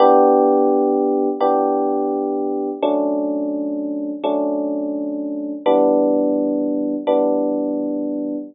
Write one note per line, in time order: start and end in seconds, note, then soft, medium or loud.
0.00 1.29 E3 loud
0.00 1.29 B3 loud
0.00 1.29 D4 loud
0.00 1.29 G4 loud
1.40 2.70 E3 medium
1.40 2.70 B3 medium
1.40 2.70 D4 medium
1.40 2.70 G4 medium
2.82 4.12 F#3 loud
2.82 4.12 A3 medium
2.82 4.12 C#4 loud
2.82 4.12 D4 loud
4.24 5.53 F#3 medium
4.24 5.53 A3 medium
4.24 5.53 C#4 loud
4.24 5.53 D4 medium
5.66 6.95 E3 loud
5.66 6.95 G3 loud
5.66 6.95 B3 loud
5.66 6.95 D4 loud
7.07 8.36 E3 medium
7.07 8.36 G3 medium
7.07 8.36 B3 medium
7.07 8.36 D4 loud